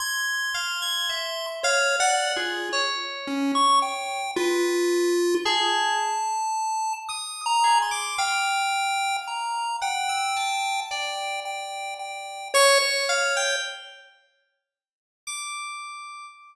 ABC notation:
X:1
M:5/8
L:1/16
Q:1/4=55
K:none
V:1 name="Lead 1 (square)"
c'6 (3^c2 d2 F2 | z2 ^C ^c' g2 F4 | a6 (3^d'2 ^a2 c'2 | g4 ^a2 g4 |
g2 g2 g2 ^c c3 | z10 |]
V:2 name="Electric Piano 2"
^g'2 f g' e2 (3f2 ^f2 ^G2 | ^c6 B3 z | ^G2 z4 ^d'2 G =d' | f6 ^f e' a2 |
d6 ^c'2 f g | z6 d'4 |]